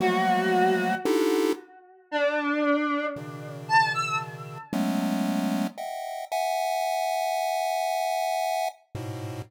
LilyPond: <<
  \new Staff \with { instrumentName = "Lead 1 (square)" } { \time 6/8 \tempo 4. = 38 <f ges g a bes>4 <d' ees' e' f' g' a'>8 r4. | <b, des ees>4. <ges aes a b des'>4 <ees'' e'' ges'' g''>8 | <e'' ges'' aes''>2~ <e'' ges'' aes''>8 <aes, a, b,>8 | }
  \new Staff \with { instrumentName = "Lead 1 (square)" } { \time 6/8 ges'4 r4 d'4 | r8 a''16 e'''16 r2 | r2. | }
>>